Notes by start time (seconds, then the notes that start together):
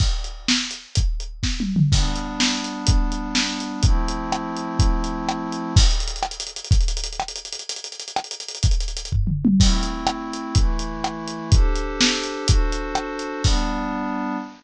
0.00 kick, crash
0.24 closed hi-hat
0.48 snare
0.71 closed hi-hat
0.95 kick, closed hi-hat
1.20 closed hi-hat
1.43 kick, snare
1.60 high tom
1.76 mid tom
1.92 G3 B3 D4, kick, crash
2.16 closed hi-hat
2.40 snare
2.64 closed hi-hat
2.87 kick, closed hi-hat
3.12 closed hi-hat
3.35 snare
3.60 closed hi-hat
3.83 F3 A3 C4 E4, kick, closed hi-hat
4.08 closed hi-hat
4.32 cross-stick
4.57 closed hi-hat
4.79 kick, closed hi-hat
5.04 closed hi-hat
5.29 cross-stick
5.52 closed hi-hat
5.76 kick, crash
5.84 closed hi-hat
5.91 closed hi-hat
6.00 closed hi-hat
6.08 closed hi-hat
6.16 closed hi-hat
6.23 cross-stick
6.31 closed hi-hat
6.40 closed hi-hat
6.47 closed hi-hat
6.56 closed hi-hat
6.64 closed hi-hat
6.71 kick, closed hi-hat
6.81 closed hi-hat
6.88 closed hi-hat
6.97 closed hi-hat
7.04 closed hi-hat
7.13 closed hi-hat
7.20 cross-stick
7.28 closed hi-hat
7.36 closed hi-hat
7.45 closed hi-hat
7.52 closed hi-hat
7.59 closed hi-hat
7.69 closed hi-hat
7.76 closed hi-hat
7.84 closed hi-hat
7.92 closed hi-hat
8.00 closed hi-hat
8.08 closed hi-hat
8.16 cross-stick
8.24 closed hi-hat
8.31 closed hi-hat
8.40 closed hi-hat
8.48 closed hi-hat
8.55 closed hi-hat
8.63 kick, closed hi-hat
8.71 closed hi-hat
8.80 closed hi-hat
8.88 closed hi-hat
8.97 closed hi-hat
9.05 closed hi-hat
9.12 kick, floor tom
9.27 mid tom
9.45 high tom
9.60 A3 C4 E4, kick, crash
9.83 closed hi-hat
10.07 cross-stick
10.33 closed hi-hat
10.55 E3 A3 E4, kick, closed hi-hat
10.79 closed hi-hat
11.04 cross-stick
11.28 closed hi-hat
11.52 D4 G4 A4 C5, kick, closed hi-hat
11.76 closed hi-hat
12.01 snare
12.23 closed hi-hat
12.47 D4 F#4 A4 C5, kick, closed hi-hat
12.72 closed hi-hat
12.95 cross-stick
13.19 closed hi-hat
13.44 G3 B3 D4, kick, crash